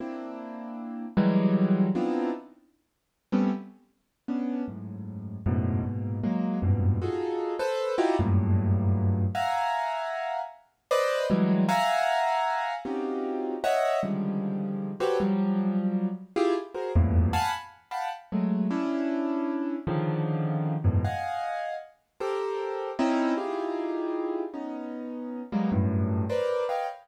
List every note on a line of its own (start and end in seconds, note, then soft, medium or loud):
0.00 1.06 A#3 medium
0.00 1.06 C4 medium
0.00 1.06 D4 medium
0.00 1.06 E4 medium
1.17 1.87 E3 loud
1.17 1.87 F#3 loud
1.17 1.87 G3 loud
1.17 1.87 G#3 loud
1.95 2.30 B3 medium
1.95 2.30 C4 medium
1.95 2.30 D4 medium
1.95 2.30 D#4 medium
1.95 2.30 E4 medium
1.95 2.30 F4 medium
3.32 3.50 G3 medium
3.32 3.50 A3 medium
3.32 3.50 B3 medium
3.32 3.50 C4 medium
3.32 3.50 C#4 medium
4.28 4.63 B3 medium
4.28 4.63 C#4 medium
4.28 4.63 D4 medium
4.68 5.38 F#2 soft
4.68 5.38 G#2 soft
4.68 5.38 A2 soft
5.46 5.81 F#2 loud
5.46 5.81 G#2 loud
5.46 5.81 A2 loud
5.46 5.81 B2 loud
5.84 6.19 G#2 medium
5.84 6.19 A#2 medium
5.84 6.19 B2 medium
6.23 6.59 F#3 medium
6.23 6.59 G#3 medium
6.23 6.59 A#3 medium
6.62 6.97 F#2 medium
6.62 6.97 G2 medium
6.62 6.97 G#2 medium
6.62 6.97 A#2 medium
6.62 6.97 B2 medium
7.02 7.54 D#4 medium
7.02 7.54 F4 medium
7.02 7.54 F#4 medium
7.02 7.54 G#4 medium
7.02 7.54 A4 medium
7.59 7.94 A4 medium
7.59 7.94 B4 medium
7.59 7.94 C5 medium
7.98 8.16 D#4 loud
7.98 8.16 E4 loud
7.98 8.16 F4 loud
7.98 8.16 F#4 loud
7.98 8.16 G4 loud
8.19 9.24 F#2 loud
8.19 9.24 G2 loud
8.19 9.24 A2 loud
8.19 9.24 A#2 loud
9.35 10.40 E5 medium
9.35 10.40 F5 medium
9.35 10.40 F#5 medium
9.35 10.40 G#5 medium
9.35 10.40 A#5 medium
10.91 11.26 B4 loud
10.91 11.26 C5 loud
10.91 11.26 D5 loud
10.91 11.26 D#5 loud
11.30 11.65 E3 loud
11.30 11.65 F#3 loud
11.30 11.65 G3 loud
11.30 11.65 G#3 loud
11.69 12.74 E5 loud
11.69 12.74 F5 loud
11.69 12.74 F#5 loud
11.69 12.74 G#5 loud
11.69 12.74 A#5 loud
12.85 13.55 C4 medium
12.85 13.55 C#4 medium
12.85 13.55 D#4 medium
12.85 13.55 F4 medium
12.85 13.55 F#4 medium
12.85 13.55 G4 medium
13.64 13.99 C#5 medium
13.64 13.99 D#5 medium
13.64 13.99 E5 medium
13.64 13.99 F#5 medium
14.03 14.91 C#3 medium
14.03 14.91 D3 medium
14.03 14.91 D#3 medium
14.03 14.91 F3 medium
14.03 14.91 G3 medium
14.03 14.91 G#3 medium
15.00 15.18 F#4 medium
15.00 15.18 G4 medium
15.00 15.18 A4 medium
15.00 15.18 B4 medium
15.00 15.18 C5 medium
15.00 15.18 C#5 medium
15.20 16.08 F3 medium
15.20 16.08 F#3 medium
15.20 16.08 G3 medium
16.36 16.54 E4 loud
16.36 16.54 F4 loud
16.36 16.54 G4 loud
16.36 16.54 G#4 loud
16.74 16.92 F#4 medium
16.74 16.92 G#4 medium
16.74 16.92 A#4 medium
16.74 16.92 C5 medium
16.96 17.31 E2 loud
16.96 17.31 F2 loud
16.96 17.31 G2 loud
16.96 17.31 A2 loud
16.96 17.31 A#2 loud
17.33 17.51 F5 loud
17.33 17.51 F#5 loud
17.33 17.51 G#5 loud
17.33 17.51 A5 loud
17.33 17.51 B5 loud
17.91 18.09 F5 medium
17.91 18.09 F#5 medium
17.91 18.09 G5 medium
17.91 18.09 A5 medium
17.91 18.09 B5 medium
18.32 18.67 F#3 medium
18.32 18.67 G#3 medium
18.32 18.67 A3 medium
18.71 19.76 C#4 medium
18.71 19.76 D4 medium
18.71 19.76 E4 medium
19.87 20.75 C#3 loud
19.87 20.75 D3 loud
19.87 20.75 D#3 loud
19.87 20.75 F3 loud
20.84 21.02 E2 loud
20.84 21.02 F#2 loud
20.84 21.02 G#2 loud
20.84 21.02 A2 loud
20.84 21.02 B2 loud
21.04 21.75 D#5 medium
21.04 21.75 F5 medium
21.04 21.75 F#5 medium
21.04 21.75 G#5 medium
22.20 22.91 G4 medium
22.20 22.91 A4 medium
22.20 22.91 A#4 medium
22.20 22.91 C5 medium
22.99 23.34 C4 loud
22.99 23.34 C#4 loud
22.99 23.34 D#4 loud
22.99 23.34 E4 loud
23.37 24.43 D#4 medium
23.37 24.43 E4 medium
23.37 24.43 F4 medium
23.37 24.43 G4 medium
23.37 24.43 G#4 medium
24.54 25.41 B3 medium
24.54 25.41 C#4 medium
24.54 25.41 D#4 medium
25.52 25.70 F#3 medium
25.52 25.70 G3 medium
25.52 25.70 G#3 medium
25.52 25.70 A#3 medium
25.52 25.70 B3 medium
25.72 26.24 F#2 loud
25.72 26.24 G2 loud
25.72 26.24 A2 loud
26.29 26.65 A#4 medium
26.29 26.65 B4 medium
26.29 26.65 C5 medium
26.29 26.65 D5 medium
26.69 26.86 B4 medium
26.69 26.86 C#5 medium
26.69 26.86 D#5 medium
26.69 26.86 F5 medium
26.69 26.86 G5 medium